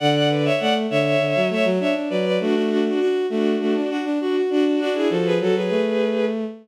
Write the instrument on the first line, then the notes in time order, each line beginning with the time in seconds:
violin
0.00 D3 D5 F#5
0.15 D5 F#5
0.29 B4 D5
0.45 C#5 E5
0.59 A3 D5 F#5
0.90 D3 C#5 E5
1.19 D3
1.35 F#3
1.50 A3 C#5 E5
1.64 F#3
1.80 D4 C#5 E5
1.95 D4
2.10 F#3 B4 D5
2.25 B4 D5
2.40 A3 D4 F#4
2.55 D4 F#4
2.70 D4 F#4
2.85 D4 F#4
3.00 D4 F#4
3.30 A3 D4 F#4
3.61 A3
3.75 D4
3.90 D4 F#4
4.04 D4
4.21 D4 F#4
4.36 F#4
4.50 D4 F#4
4.65 D4 F#4
4.79 D4 F#4
4.94 E4 G#4
5.10 F3 F#4 A4
5.25 G#4 B4
5.40 F#3 F#4 A4
5.55 F#3 G#4 B4
5.70 A3